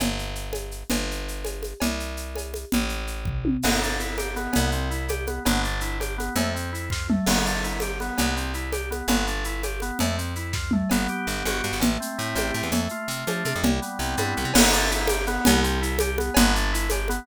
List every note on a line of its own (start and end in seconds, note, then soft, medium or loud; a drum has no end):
0.00 0.84 G1 medium
0.00 cowbell medium
0.00 low conga medium
0.00 shaker medium
0.19 shaker medium
0.35 shaker medium
0.53 cowbell medium
0.53 high conga medium
0.53 shaker medium
0.71 shaker medium
0.90 1.74 G1 medium
0.90 cowbell medium
0.90 low conga medium
0.90 shaker medium
1.11 shaker medium
1.28 shaker medium
1.45 cowbell medium
1.45 high conga medium
1.45 shaker medium
1.63 high conga medium
1.63 shaker medium
1.80 2.65 C2 medium
1.80 cowbell medium
1.80 low conga medium
1.80 shaker medium
2.00 shaker medium
2.17 shaker medium
2.35 cowbell medium
2.35 high conga medium
2.35 shaker medium
2.54 high conga medium
2.54 shaker medium
2.72 3.57 A1 medium
2.72 low conga loud
2.72 shaker medium
2.89 shaker medium
3.07 shaker medium
3.25 kick medium
3.25 floor tom medium
3.45 high tom medium
3.62 4.48 G1 loud
3.62 3.80 B3 medium
3.62 crash loud
3.62 cowbell medium
3.62 low conga medium
3.62 shaker medium
3.82 3.98 D4 medium
3.82 shaker medium
4.00 4.16 E4 medium
4.00 shaker medium
4.17 4.34 G4 medium
4.17 cowbell medium
4.17 high conga medium
4.17 shaker medium
4.36 4.71 B3 medium
4.36 high conga medium
4.36 shaker medium
4.53 5.39 C2 loud
4.53 cowbell medium
4.53 low conga medium
4.53 shaker medium
4.72 4.89 C4 medium
4.72 shaker medium
4.91 5.07 E4 medium
4.91 shaker medium
5.08 5.26 G4 medium
5.08 cowbell medium
5.08 high conga medium
5.08 shaker medium
5.27 5.43 B3 medium
5.27 high conga medium
5.27 shaker medium
5.45 6.30 G1 loud
5.45 5.62 B3 medium
5.45 cowbell medium
5.45 low conga medium
5.45 shaker medium
5.64 5.80 D4 medium
5.64 shaker medium
5.81 5.98 E4 medium
5.81 shaker medium
6.00 6.16 G4 medium
6.00 cowbell medium
6.00 high conga medium
6.00 shaker medium
6.18 6.34 B3 medium
6.18 high conga medium
6.18 shaker medium
6.36 7.19 F2 loud
6.36 6.53 A3 loud
6.36 cowbell medium
6.36 low conga medium
6.36 shaker medium
6.54 6.71 C4 medium
6.54 shaker medium
6.73 6.89 E4 medium
6.73 shaker medium
6.90 7.07 F4 medium
6.90 kick medium
6.90 snare medium
7.09 7.26 A3 medium
7.09 mid tom loud
7.26 8.11 G1 loud
7.26 7.44 B3 medium
7.26 crash loud
7.26 cowbell medium
7.26 low conga medium
7.26 shaker medium
7.45 7.62 D4 medium
7.45 shaker medium
7.63 7.80 E4 medium
7.63 shaker medium
7.80 7.98 G4 medium
7.80 cowbell medium
7.80 high conga medium
7.80 shaker medium
8.00 8.35 B3 medium
8.00 high conga medium
8.00 shaker medium
8.18 9.02 C2 loud
8.18 cowbell medium
8.18 low conga medium
8.18 shaker medium
8.36 8.53 C4 medium
8.36 shaker medium
8.54 8.71 E4 medium
8.54 shaker medium
8.72 8.89 G4 medium
8.72 cowbell medium
8.72 high conga medium
8.72 shaker medium
8.91 9.07 B3 medium
8.91 high conga medium
8.91 shaker medium
9.08 9.91 G1 loud
9.08 9.26 B3 medium
9.08 cowbell medium
9.08 low conga medium
9.08 shaker medium
9.27 9.44 D4 medium
9.27 shaker medium
9.44 9.62 E4 medium
9.44 shaker medium
9.63 9.80 G4 medium
9.63 cowbell medium
9.63 high conga medium
9.63 shaker medium
9.80 9.98 B3 medium
9.80 high conga medium
9.80 shaker medium
9.99 10.84 F2 loud
9.99 10.16 A3 loud
9.99 cowbell medium
9.99 low conga medium
9.99 shaker medium
10.18 10.34 C4 medium
10.18 shaker medium
10.35 10.53 E4 medium
10.35 shaker medium
10.53 10.71 F4 medium
10.53 kick medium
10.53 snare medium
10.71 10.89 A3 medium
10.71 mid tom loud
10.90 11.08 G1 medium
10.90 11.27 B3 medium
10.90 cowbell medium
10.90 low conga medium
10.90 shaker medium
11.08 11.78 G4 medium
11.08 shaker medium
11.27 11.43 G1 medium
11.27 11.63 B3 medium
11.27 shaker medium
11.45 11.62 G1 medium
11.45 11.80 F#4 medium
11.45 cowbell medium
11.45 high conga medium
11.45 shaker medium
11.63 11.72 G2 medium
11.63 11.81 B3 medium
11.63 shaker medium
11.73 11.81 G1 medium
11.80 11.98 A1 medium
11.80 12.54 A3 medium
11.80 cowbell medium
11.80 low conga loud
11.80 shaker medium
12.00 12.69 C4 medium
12.00 shaker medium
12.18 12.35 A2 medium
12.18 12.70 E4 medium
12.18 shaker medium
12.35 12.52 A1 medium
12.35 12.71 G4 medium
12.35 cowbell medium
12.35 high conga medium
12.35 shaker medium
12.54 12.63 A2 medium
12.54 12.72 A3 medium
12.54 shaker medium
12.63 12.71 E2 medium
12.72 12.88 F2 medium
12.72 13.09 A3 medium
12.72 cowbell medium
12.72 low conga medium
12.72 shaker medium
12.89 13.60 F4 medium
12.89 shaker medium
13.08 13.24 C3 medium
13.08 13.45 A3 medium
13.08 shaker medium
13.27 13.44 F3 medium
13.27 13.62 D4 medium
13.27 cowbell medium
13.27 high conga medium
13.27 shaker medium
13.45 13.53 C3 medium
13.45 13.63 A3 medium
13.45 high conga medium
13.45 shaker medium
13.56 13.64 F2 medium
13.63 13.80 C2 medium
13.63 14.36 G3 medium
13.63 cowbell medium
13.63 low conga loud
13.82 14.51 B3 medium
13.82 shaker medium
13.99 14.15 C2 medium
13.99 14.52 C4 medium
13.99 shaker medium
14.17 14.34 G2 medium
14.17 14.53 E4 medium
14.17 cowbell medium
14.17 high conga medium
14.17 shaker medium
14.36 14.45 C2 medium
14.36 14.54 G3 medium
14.36 shaker soft
14.45 14.53 C3 medium
14.54 15.39 G1 loud
14.54 14.71 B3 loud
14.54 crash loud
14.54 cowbell loud
14.54 low conga loud
14.54 shaker medium
14.73 14.89 D4 medium
14.73 shaker medium
14.91 15.07 E4 medium
14.91 shaker medium
15.07 15.25 G4 medium
15.07 cowbell medium
15.07 high conga loud
15.07 shaker medium
15.27 15.62 B3 loud
15.27 high conga medium
15.27 shaker medium
15.45 16.30 C2 loud
15.45 cowbell loud
15.45 low conga loud
15.45 shaker loud
15.63 15.80 C4 medium
15.63 shaker medium
15.82 15.98 E4 medium
15.82 shaker medium
15.99 16.16 G4 medium
15.99 cowbell medium
15.99 high conga loud
15.99 shaker medium
16.18 16.34 B3 medium
16.18 high conga medium
16.18 shaker medium
16.34 17.20 G1 loud
16.34 16.53 B3 loud
16.34 cowbell loud
16.34 low conga loud
16.34 shaker medium
16.55 16.71 D4 medium
16.55 shaker medium
16.73 16.89 E4 medium
16.73 shaker medium
16.90 17.07 G4 medium
16.90 cowbell medium
16.90 high conga medium
16.90 shaker medium
17.08 17.26 B3 loud
17.08 high conga medium
17.08 shaker medium